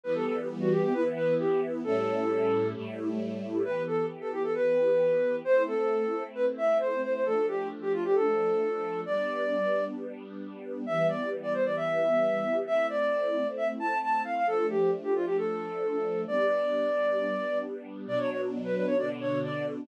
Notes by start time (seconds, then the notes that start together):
0.04 E3 G3 B3 B4
0.15 A4
0.26 A4
0.60 F#4
0.71 G4
0.83 G4
0.93 E3 B3 E4 B4
1.16 B4
1.39 G4
1.84 A2 G3 C#4 E4 A4
2.74 A2 G3 A3 E4
3.63 E3 B3 G4 B4
3.87 A4
4.21 A4
4.32 G4
4.43 A4
4.55 B4
5.45 A3 C4 E4 C5
5.67 A4
6.35 B4
6.58 E5
6.80 C5
7.03 C5
7.14 C5
7.25 F3 A3 D4 A4
7.48 G4
7.82 G4
7.93 F4
8.04 G4
8.15 A4
9.06 G3 B3 D4 D5
10.86 E3 G3 B3 E5
11.09 D5
11.43 D5
11.54 C5
11.65 D5
11.77 E5
12.65 A3 C4 E4 E5
12.89 D5
13.57 E5
13.80 A5
14.02 A5
14.24 F5
14.36 F5
14.46 F3 A3 D4 A4
14.70 G4
15.03 G4
15.15 F4
15.26 G4
15.37 A4
16.27 G3 B3 D4 D5
18.07 B2 F#3 D4 D5
18.19 C#5
18.30 C#5
18.64 B4
18.76 B4
18.87 C#5
18.98 B2 D3 D4 D5
19.21 C#5
19.43 D5